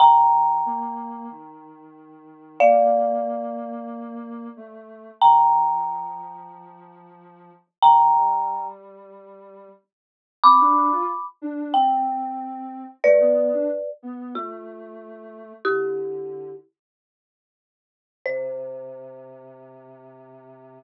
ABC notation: X:1
M:4/4
L:1/16
Q:1/4=92
K:Bb
V:1 name="Marimba"
[gb]16 | [df]16 | [gb]16 | [gb]6 z10 |
[K:C] [bd']6 z2 g8 | [Bd]6 z2 F8 | [EG]6 z10 | c16 |]
V:2 name="Ocarina"
F,4 B,4 E,8 | B,12 A,4 | F,16 | F,2 G,10 z4 |
[K:C] C D2 F z2 D2 C8 | A, B,2 D z2 B,2 A,8 | D,6 z10 | C,16 |]